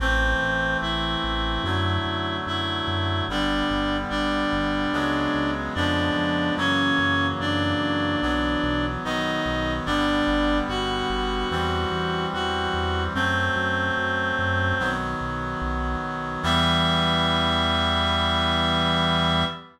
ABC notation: X:1
M:4/4
L:1/8
Q:1/4=73
K:Em
V:1 name="Clarinet"
[Cc]2 [Ee]4 [Ee]2 | [Dd]2 [Dd]4 [Dd]2 | [^C^c]2 [Dd]4 [^D^d]2 | [Dd]2 [Ff]4 [Ff]2 |
[Cc]5 z3 | e8 |]
V:2 name="Clarinet"
[E,A,C]4 [D,F,A,]4 | [D,G,B,]4 [^C,F,^G,B,]2 [C,^E,G,B,]2 | [^C,E,F,^A,]4 [E,F,B,]2 [^D,F,B,]2 | [D,G,B,]4 [E,G,C]4 |
[F,A,C]4 [^D,F,B,]4 | [E,G,B,]8 |]
V:3 name="Synth Bass 1" clef=bass
A,,, A,,, A,,, A,,, F,, F,, F,, F,, | G,,, G,,, G,,, G,,, ^C,, C,, ^E,, E,, | F,, F,, F,, F,, B,,, B,,, B,,, B,,, | G,,, G,,, G,,, G,,, E,, E,, E,, E,, |
F,, F,, F,, F,, B,,, B,,, B,,, B,,, | E,,8 |]